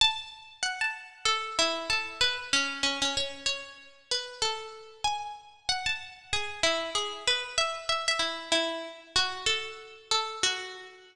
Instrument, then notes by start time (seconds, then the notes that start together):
pizzicato strings
0.01 A5
0.63 F#5
0.81 A5
1.25 A4
1.59 E4
1.90 A4
2.21 B4
2.53 C#4
2.83 C#4
3.02 C#4
3.17 C#5
3.46 C#5
4.11 B4
4.42 A4
5.04 G#5
5.69 F#5
5.86 A5
6.33 G#4
6.63 E4
6.95 G#4
7.28 B4
7.58 E5
7.89 E5
8.08 E5
8.19 E4
8.52 E4
9.16 F#4
9.46 A4
10.11 A4
10.43 F#4